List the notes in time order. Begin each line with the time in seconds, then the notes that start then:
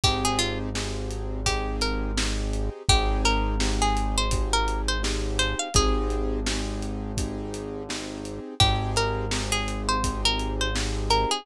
0.04 G#1 C4 D#4 G4 G#4, kick, closed hi-hat
0.25 G#4
0.39 F4, closed hi-hat
0.75 C4 D#4 G4 G#4, snare
1.11 closed hi-hat
1.46 C4 D#4 G4 G#4, kick, closed hi-hat
1.81 A#4, closed hi-hat
2.17 C4 D#4 G4 G#4, snare
2.53 closed hi-hat
2.89 G#1 C4 D#4 G4 G#4, kick, closed hi-hat
3.25 A#4, closed hi-hat
3.60 C4 D#4 G4 G#4, snare
3.82 G#4
3.97 closed hi-hat
4.18 C5
4.31 C4 D#4 G4 G#4, kick, closed hi-hat
4.53 A#4
4.68 closed hi-hat
4.88 C5
5.03 C4 D#4 G4 G#4, snare
5.39 C5, closed hi-hat
5.59 F5
5.74 G#1 C4 D#4 G4 G#4, kick, closed hi-hat
6.10 closed hi-hat
6.47 C4 D#4 G4 G#4, snare
6.83 closed hi-hat
7.17 C4 D#4 G4 G#4, kick, closed hi-hat
7.54 closed hi-hat
7.89 C4 D#4 G4 G#4, snare
8.25 closed hi-hat
8.60 G#1 C4 D#4 G4 G#4, kick, closed hi-hat
8.96 A#4, closed hi-hat
9.31 C4 D#4 G4 G#4, snare
9.52 G#4
9.68 closed hi-hat
9.89 C5
10.04 C4 D#4 G4 G#4, kick, closed hi-hat
10.25 A#4
10.40 closed hi-hat
10.61 C5
10.75 C4 D#4 G4 G#4, snare
11.10 A#4, closed hi-hat
11.31 G#4